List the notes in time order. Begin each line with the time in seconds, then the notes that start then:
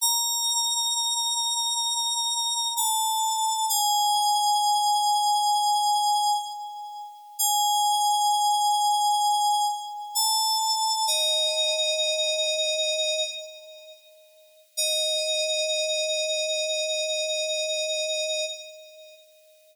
0.01 A#5
2.77 A5
3.69 G#5
7.39 G#5
10.15 A5
11.07 D#5
14.77 D#5